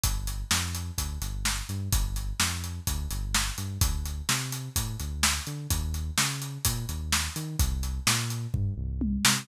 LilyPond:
<<
  \new Staff \with { instrumentName = "Synth Bass 1" } { \clef bass \time 4/4 \key g \minor \tempo 4 = 127 g,,4 f,4 d,8 g,,4 g,8 | g,,4 f,4 d,8 g,,4 g,8 | d,4 c4 a,8 d,4 d8 | ees,4 des4 bes,8 ees,4 ees8 |
c,4 bes,4 g,8 c,4 c8 | }
  \new DrumStaff \with { instrumentName = "Drums" } \drummode { \time 4/4 <hh bd>8 hh8 sn8 hh8 <hh bd>8 hh8 sn8 hh8 | <hh bd>8 hh8 sn8 hh8 <hh bd>8 hh8 sn8 hh8 | <hh bd>8 hh8 sn8 hh8 <hh bd>8 hh8 sn8 hh8 | <hh bd>8 hh8 sn8 hh8 <hh bd>8 hh8 sn8 hh8 |
<hh bd>8 hh8 sn8 hh8 <bd tomfh>4 tommh8 sn8 | }
>>